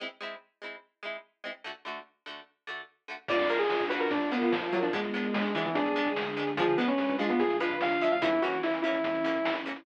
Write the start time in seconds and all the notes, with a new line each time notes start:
0.00 G#3 C4 E4
0.21 G#3 C4 E4
0.62 G#3 C4 E4
1.03 G#3 C4 E4
1.44 G#3 C4 E4
1.64 D3 A3 F#4
1.85 D3 A3 F#4
2.26 D3 A3 F#4
2.67 D3 A3 F#4
3.08 D3 A3 F#4
3.28 A#1 A#3 D4 F4 D5, kick, crash
3.39 F2, closed hi-hat
3.49 A#3 D4 F4 A#4, closed hi-hat
3.59 G#4, closed hi-hat
3.70 snare
3.80 kick, closed hi-hat
3.89 A#3 D4 F4 F#4 B4, closed hi-hat
4.00 A#1 A#4, closed hi-hat
4.11 A#2 A#3 D4 F4 A#4, kick, closed hi-hat
4.21 A#1, closed hi-hat
4.32 A#3 B3 D4 F4, closed hi-hat
4.41 F4, kick, closed hi-hat
4.52 A#2 F3, snare
4.62 closed hi-hat
4.73 F#3 A#3 D4 F4, closed hi-hat
4.82 F2 F3 D4, closed hi-hat
4.93 G#1 G#3 B3 D4, kick, closed hi-hat
5.04 G#1, closed hi-hat
5.14 G#3 B3 D4, closed hi-hat
5.24 closed hi-hat
5.34 G#3, snare
5.44 closed hi-hat
5.55 E3 G#3 B3 D4, closed hi-hat
5.65 G#1 E3, closed hi-hat
5.75 G#1 D3 G#3 D4 G#4, kick, closed hi-hat
5.86 G#1, closed hi-hat
5.96 G#3 B3 D4, closed hi-hat
6.06 kick, closed hi-hat
6.16 D2, snare
6.27 closed hi-hat
6.37 G#3 B3 D4, closed hi-hat
6.47 D2, snare, closed hi-hat
6.57 D2 F3 G#3 D4 G#4, kick, closed hi-hat
6.68 D3, closed hi-hat
6.77 F3 G#3 B3 D4 B4, closed hi-hat
6.88 C#4, snare, closed hi-hat
6.98 snare
7.09 kick, closed hi-hat
7.19 F3 G#3 D4 F4, snare, closed hi-hat
7.29 D2 B3, closed hi-hat
7.39 D2 D3 F3 D4 G#4, kick, closed hi-hat
7.50 D2, closed hi-hat
7.60 F3 G#3 D4 F4 B4, closed hi-hat
7.70 kick, closed hi-hat
7.80 D2 F5, snare
7.91 closed hi-hat
8.01 F3 G#3 D4 E5, closed hi-hat
8.12 D2 F5, closed hi-hat
8.22 A#1 E3 A#3 C#4 E4, kick, closed hi-hat
8.32 E2, closed hi-hat
8.42 E3 A#3 C#4 F#4, closed hi-hat
8.52 closed hi-hat
8.63 E4, snare
8.74 closed hi-hat
8.82 E3 A#3 E4, closed hi-hat
8.86 C#4
8.94 A#1, closed hi-hat
9.04 E2 E3 C#4 E4, kick, closed hi-hat
9.14 A#1, closed hi-hat
9.24 E3 A#3 C#4, closed hi-hat
9.35 kick, closed hi-hat
9.45 A#1, snare
9.55 closed hi-hat
9.66 E3 A#3 C#4, snare, closed hi-hat
9.76 A#1, closed hi-hat